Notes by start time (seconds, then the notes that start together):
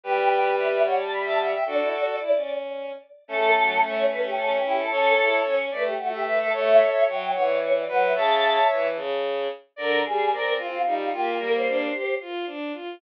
0.03 G3 G4 B4 G5
0.58 E5
0.85 C#5 F#5
0.99 A5
1.12 B5
1.25 E5 A5
1.39 E5 F#5
1.52 E5 G5
1.66 D4 F#4 A4 D5
1.80 E4
1.93 F#4
2.20 E4
2.35 C#4
3.28 A3 C#4 A4
3.57 F#3
3.82 A3 C#5
4.09 C#4 B4
4.23 G4
4.37 C#4 A4
4.50 G4
4.64 E4 G4
4.77 A4
4.91 C#4 A4 C#5
5.19 E4
5.44 C#4 C#5
5.71 A3 B4 D5
5.85 G4
5.98 A3 F#4
6.13 G4 E5
6.26 B4 E5
6.39 A4 E5
6.53 A3 A4 C#5 E5
7.06 F#3 C#5 G5
7.34 E3 C#5 F#5
7.48 D5
7.61 C#5
7.74 D5
7.87 F#3 B4 F#5
8.02 E5
8.15 C#3 C#5 E5 A5
8.71 E3
8.95 C#3
9.76 D3 A#4 D5
10.04 G3 G#4
10.31 C4 A#4 D5
10.58 C4 F4
10.85 G3 D#4
10.99 F4
11.12 A#3 F4 G4
11.39 G3 A#3 A#4
11.53 C5
11.68 D4
11.92 G4
12.21 F4
12.46 D4
12.73 F4